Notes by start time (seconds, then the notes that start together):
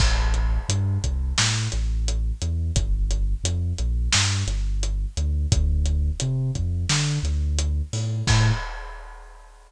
0.00 A1, kick, crash
0.34 closed hi-hat
0.69 G2, closed hi-hat
1.04 C2, kick, closed hi-hat
1.38 A2, snare
1.72 A1, closed hi-hat
2.08 closed hi-hat
2.42 E2, closed hi-hat
2.76 G1, kick, closed hi-hat
3.11 closed hi-hat
3.44 F2, closed hi-hat
3.78 A#1, closed hi-hat
4.12 G2, snare
4.47 G1, closed hi-hat
4.83 closed hi-hat
5.17 D2, closed hi-hat
5.52 D2, kick, closed hi-hat
5.86 closed hi-hat
6.20 C3, closed hi-hat
6.55 F2, kick, closed hi-hat
6.89 D3, snare
7.23 D2, closed hi-hat
7.59 closed hi-hat
7.93 A2, open hi-hat
8.27 A2, kick, crash